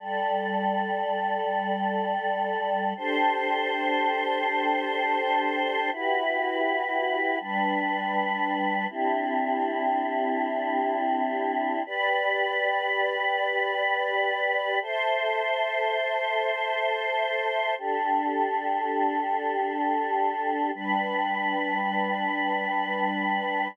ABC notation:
X:1
M:4/4
L:1/8
Q:1/4=81
K:G
V:1 name="Choir Aahs"
[G,Ad]8 | [DGAc]8 | [EFGB]4 [G,DB]4 | [CDEG]8 |
[GBd]8 | [Ace]8 | [DGA]8 | [G,DB]8 |]